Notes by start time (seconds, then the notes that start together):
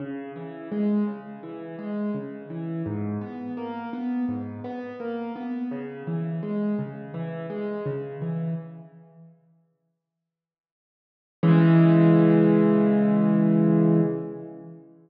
0.00 C#3
0.36 E3
0.72 G#3
1.07 C#3
1.43 E3
1.79 G#3
2.14 C#3
2.50 E3
2.86 G#2
3.21 B3
3.57 A#3
3.93 B3
4.28 G#2
4.64 B3
5.00 A#3
5.36 B3
5.71 C#3
6.07 E3
6.43 G#3
6.79 C#3
7.14 E3
7.50 G#3
7.86 C#3
8.22 E3
11.43 C#3 E3 G#3